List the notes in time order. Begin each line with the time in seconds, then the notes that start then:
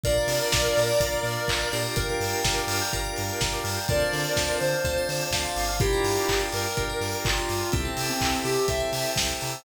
0.04 A#1 D4 F4 A#4 D5 F5 A#5, kick, closed hi-hat
0.18 D5
0.27 C3 F5, open hi-hat
0.41 A#5
0.52 A#1 D6, kick, snare
0.65 F6
0.77 A#2 A#4, open hi-hat
0.89 D5
1.00 A#1 D4 F4 A#4 F5, kick, closed hi-hat
1.12 A#5
1.23 A#2 D6, open hi-hat
1.37 F6
1.48 A#1 A#4, kick, clap
1.60 D5
1.72 A#2 D4 F4 G4 A#4, open hi-hat
1.96 G1 A#4 D5 F5 G5 A#5, kick, closed hi-hat
2.09 A#4 D5
2.20 G2 F5, open hi-hat
2.33 G5
2.43 G1 A#5, kick, snare
2.57 D6
2.67 G2 F6, open hi-hat
2.82 G6
2.93 G1 D4 F4 G4 A#4, kick, closed hi-hat
3.04 D5
3.16 G2 F5, open hi-hat
3.29 G5
3.41 G1 A#5, kick, snare
3.53 D6
3.64 G2 F6, open hi-hat
3.77 G6
3.88 D2 C4 D4 F4 A4 A#4 C5 D5 F5 A5, kick, closed hi-hat
4.00 C5
4.13 D3 D5, open hi-hat
4.24 F5
4.37 D2 A5, kick, snare
4.49 C6
4.60 D3 C5 D6, open hi-hat
4.73 F6
4.84 D2 C4 D4 F4 A4, kick, closed hi-hat
4.98 C5
5.09 D3 D5, open hi-hat
5.21 F5
5.31 D2 F5 A5, kick, snare
5.45 C6
5.56 G1 D6, open hi-hat
5.69 F6
5.80 D4 E4 F4 G4 A#4 D5 F5 G5 A#5, kick, closed hi-hat
5.92 A#4
6.04 G2 D5, open hi-hat
6.16 F5
6.28 G1 G5, kick, clap
6.39 A#5
6.52 G2 A#4 D6, open hi-hat
6.64 F6
6.76 G1 D4 F4 G4 A#4, kick, closed hi-hat
6.90 A#4
7.01 G2 D5, open hi-hat
7.12 F5
7.25 G1 F4 G5, kick, clap
7.37 A#5
7.49 G2 D6, open hi-hat
7.61 F6
7.72 C2 C4 E4 G4 A4 C5 E5 G5 A5, kick, closed hi-hat
7.85 A4
7.97 C3 C5, open hi-hat
8.08 C4 E5
8.21 C2 G5, kick, clap
8.33 A5
8.44 C3 G4 C6, open hi-hat
8.55 E6
8.68 C2 C4 E4 G4 A4 E5, kick, closed hi-hat
8.80 G#4
8.92 C3 C5, open hi-hat
9.05 E5
9.16 C2 G5, kick, snare
9.28 A5
9.41 C3 A#5, open hi-hat
9.53 E6